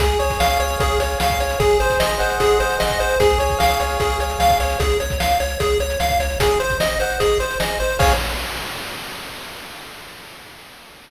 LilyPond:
<<
  \new Staff \with { instrumentName = "Lead 1 (square)" } { \time 4/4 \key des \major \tempo 4 = 150 aes'8 des''8 f''8 des''8 aes'8 des''8 f''8 des''8 | aes'8 c''8 ees''8 c''8 aes'8 c''8 ees''8 c''8 | aes'8 des''8 f''8 des''8 aes'8 des''8 f''8 des''8 | aes'8 des''8 f''8 des''8 aes'8 des''8 f''8 des''8 |
aes'8 c''8 ees''8 c''8 aes'8 c''8 ees''8 c''8 | des''4 r2. | }
  \new Staff \with { instrumentName = "Lead 1 (square)" } { \time 4/4 \key des \major aes'8 des''8 f''8 des''8 aes'8 des''8 f''8 des''8 | aes'8 c''8 ees''8 ges''8 ees''8 c''8 aes'8 c''8 | aes'8 des''8 f''8 des''8 aes'8 des''8 f''8 des''8 | r1 |
aes'8 c''8 ees''8 ges''8 ees''8 c''8 aes'8 c''8 | <aes' des'' f''>4 r2. | }
  \new Staff \with { instrumentName = "Synth Bass 1" } { \clef bass \time 4/4 \key des \major des,8 des,8 des,8 des,8 des,8 des,8 des,8 des,8 | aes,,8 aes,,8 aes,,8 aes,,8 aes,,8 aes,,8 aes,,8 aes,,8 | des,8 des,8 des,8 des,8 des,8 des,8 des,8 des,8 | des,8 des,8 des,8 des,8 des,8 des,8 des,8 des,8 |
aes,,8 aes,,8 aes,,8 aes,,8 aes,,8 aes,,8 aes,,8 aes,,8 | des,4 r2. | }
  \new DrumStaff \with { instrumentName = "Drums" } \drummode { \time 4/4 <hh bd>16 hh16 hh16 <hh bd>16 sn16 hh16 hh16 hh16 <hh bd>16 hh16 hh16 hh16 sn16 <hh bd>16 hh16 hh16 | <hh bd>16 hh16 hh16 <hh bd>16 sn16 hh16 hh16 hh16 <hh bd>16 hh16 hh16 hh16 sn16 <hh bd>16 hh16 hh16 | <hh bd>16 hh16 hh16 <hh bd>16 sn16 hh16 hh16 hh16 <hh bd>16 hh16 hh16 hh16 sn16 <hh bd>16 hh16 hh16 | <hh bd>16 hh16 hh16 <hh bd>16 sn16 hh16 hh16 hh16 <hh bd>16 hh16 hh16 hh16 sn16 <hh bd>16 hh16 hh16 |
<hh bd>16 hh16 hh16 <hh bd>16 sn16 hh16 hh16 hh16 <hh bd>16 hh16 hh16 hh16 sn16 hh16 hh16 hh16 | <cymc bd>4 r4 r4 r4 | }
>>